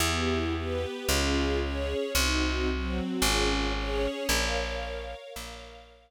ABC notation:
X:1
M:4/4
L:1/8
Q:1/4=112
K:Bbm
V:1 name="String Ensemble 1"
[=B,=E=G]2 [B,G=B]2 [DFA]2 [DAd]2 | [CEG]2 [G,CG]2 [DFA]2 [DAd]2 | [Bdf]4 [Bdf]4 |]
V:2 name="Electric Bass (finger)" clef=bass
=E,,4 D,,4 | C,,4 A,,,4 | B,,,4 B,,,4 |]